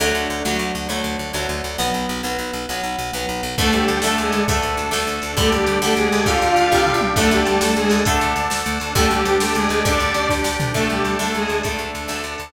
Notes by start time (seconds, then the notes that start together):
0.00 D2 D3 F#3 A3
0.15 D2
0.30 D2
0.45 D2 D3 F#3 A3
0.59 D2
0.75 D2
0.89 D2 D3 F#3 A3
1.04 D2
1.19 D2
1.33 D2 D3 F#3 A3
1.49 D2
1.64 D2
1.78 B1 F#3 B3
1.94 B1
2.09 B1
2.23 B1 F#3 B3
2.38 B1
2.53 B1
2.69 B1 F#3 B3
2.83 B1
2.99 B1
3.13 B1 F#3 B3
3.29 B1
3.43 B1
3.57 D2 D3 A3 D4 A4, kick, crash
3.72 D2 G3 G4, closed hi-hat
3.88 D2, closed hi-hat
4.02 D2 D3 A3 A4, snare
4.18 D2 G#3 G#4, closed hi-hat
4.32 D2, closed hi-hat
4.48 D2 D3 A3, kick, closed hi-hat
4.62 D2, closed hi-hat
4.77 D2, closed hi-hat
4.91 D2 D3 A3, snare
5.07 D2, closed hi-hat
5.22 D2, closed hi-hat
5.37 D2 D3 G3 A3 D4 G4 A4, kick, closed hi-hat
5.52 D2 G3 G4, closed hi-hat
5.66 D2, closed hi-hat
5.82 D2 D3 G3 A3 A4, snare
5.96 D2 G#3 G#4, closed hi-hat
6.12 D2, open hi-hat
6.26 D2 D3 G3 F4 F5, kick, closed hi-hat
6.41 D2, closed hi-hat
6.56 D2, closed hi-hat
6.72 C2 D3 G3, kick
6.86 floor tom
6.94 C#2
7.01 mid tom
7.16 D2 D3 A3 D4 A4, kick, crash
7.31 D2 G3 G4, closed hi-hat
7.45 D2, closed hi-hat
7.60 D2 A3 A4, snare
7.76 D2 G#3 G#4, closed hi-hat
7.90 D2, open hi-hat
8.05 D2 D3 A3, kick, closed hi-hat
8.21 D2, closed hi-hat
8.36 D2, closed hi-hat
8.50 D2, snare
8.66 D2, closed hi-hat
8.80 D2, closed hi-hat
8.95 D2 D3 G3 A3 D4 G4 A4, kick, closed hi-hat
9.10 D2 G3 G4, closed hi-hat
9.25 D2, closed hi-hat
9.40 D2 A3 A4, snare
9.54 D2 G#3 G#4, closed hi-hat
9.69 D2, closed hi-hat
9.85 D2 D3 G3 D4 D5, kick, closed hi-hat
10.00 D2, closed hi-hat
10.14 D2, closed hi-hat
10.29 D2, kick, snare
10.44 D2, snare
10.60 D2, floor tom
10.74 D2 D3 A3 D4 A4, kick, crash
10.89 D2 G3 G4, closed hi-hat
11.04 D2, closed hi-hat
11.19 D2 D3 A3 A4, snare
11.34 D2 G#3 G#4, closed hi-hat
11.48 D2, closed hi-hat
11.63 D2 D3 A3, kick, closed hi-hat
11.79 D2, closed hi-hat
11.95 D2, closed hi-hat
12.08 D2 D3 A3, snare
12.24 D2, closed hi-hat
12.38 D2, closed hi-hat